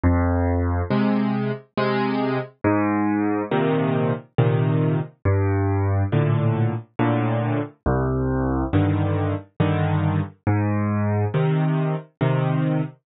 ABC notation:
X:1
M:3/4
L:1/8
Q:1/4=69
K:Cm
V:1 name="Acoustic Grand Piano" clef=bass
F,,2 [C,A,]2 [C,A,]2 | A,,2 [B,,C,E,]2 [B,,C,E,]2 | G,,2 [=A,,B,,D,]2 [A,,B,,D,]2 | C,,2 [G,,D,E,]2 [G,,D,E,]2 |
A,,2 [C,E,]2 [C,E,]2 |]